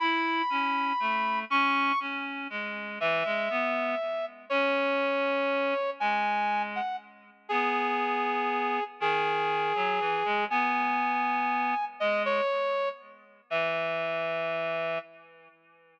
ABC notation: X:1
M:6/8
L:1/8
Q:3/8=80
K:E
V:1 name="Brass Section"
b6 | c'2 z4 | e6 | c6 |
g3 f z2 | G6 | G6 | g6 |
d c3 z2 | e6 |]
V:2 name="Clarinet"
E2 C2 A,2 | C2 C2 G,2 | E, G, B,2 z2 | C6 |
G,4 z2 | B,6 | D,3 F, E, G, | B,6 |
G,2 z4 | E,6 |]